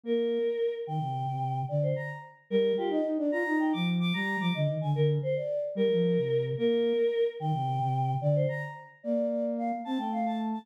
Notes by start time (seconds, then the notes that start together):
0.04 A#3 A#4
0.87 D#3 G5
1.00 C3
1.29 C3
1.69 D3 D5
1.82 C5
1.96 A#5
2.50 G3 A#4
2.77 F4 G4
2.89 D#4 D#5
3.05 D#4
3.18 D4 D5
3.32 F4 A#5
3.47 D#4
3.59 G5
3.73 F3 D6
4.00 D6
4.14 G3 A#5
4.40 F3 D6
4.55 D3 D#5
4.67 D#3
4.81 D3 G#5
4.95 D3 A#4
5.22 C5
5.36 D5
5.75 G3 A#4
5.92 F3
6.17 C3
6.58 A#3 A#4
7.40 D#3 G5
7.54 C3
7.80 C3
8.21 D3 D5
8.35 C5
8.48 A#5
9.03 A#3 D5
9.31 D5
9.57 F5
9.85 C4 A5
9.98 A3 G5
10.12 F5
10.26 A5
10.53 A5